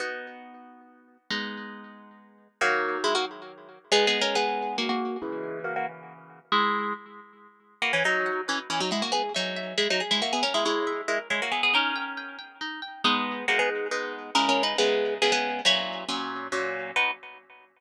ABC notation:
X:1
M:3/4
L:1/16
Q:1/4=138
K:B
V:1 name="Orchestral Harp"
z12 | z12 | [A,F]4 [G,E] [A,F] z6 | (3[B,G]2 [B,G]2 [CA]2 [B,G]4 [A,F] [A,F]3 |
[G,E]4 [A,F] [A,F] z6 | [G,E]4 z8 | [K:G#m] [A,F] [E,C] [F,D]4 [E,C] z [E,C] [F,D] [G,E] [A,F] | [B,G] z [F,D]4 [G,E] [F,D] z [G,E] [A,F] [B,G] |
[CA] [G,E] [G,E]4 [G,E] z [G,E] [A,F] [B,G] [B,G] | [CA]6 z6 | [K:B] [B,G]4 [A,F] [B,G] z6 | (3[CA]2 [CA]2 [DB]2 [B,G]4 [B,G] [B,G]3 |
[Ec]4 z8 | B4 z8 |]
V:2 name="Orchestral Harp"
[B,DF]12 | [G,B,D]12 | [D,F,]12 | [G,B,D]12 |
[C,E,]12 | z12 | [K:G#m] B2 d2 f2 B2 d2 f2 | G2 e2 e2 e2 G2 e2 |
A2 c2 e2 A2 c2 e2 | D2 =g2 g2 g2 D2 g2 | [K:B] [G,D]4 [G,B,D]4 [G,B,D]4 | [C,G,E]4 [C,G,E]4 [C,G,E]4 |
[A,,F,C]4 [A,,F,C]4 [A,,F,C]4 | [B,DF]4 z8 |]